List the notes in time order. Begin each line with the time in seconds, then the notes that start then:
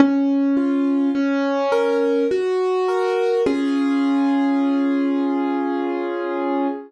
0.00 C#4
0.57 F4
1.15 C#4
1.72 A#4
2.31 F#4
2.88 A#4
3.46 C#4 F4 G#4